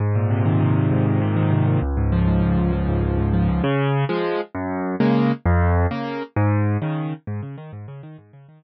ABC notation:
X:1
M:6/8
L:1/8
Q:3/8=132
K:Ab
V:1 name="Acoustic Grand Piano"
A,, B,, C, E, C, B,, | A,, B,, C, E, C, B,, | D,, A,, F, A,, D,, A,, | F, A,, D,, A,, F, A,, |
[K:Db] D,3 [F,A,]3 | G,,3 [D,A,B,]3 | F,,3 [D,B,]3 | A,,3 [D,E,]3 |
[K:Ab] A,, D, E, A,, D, E, | A,, D, E, z3 |]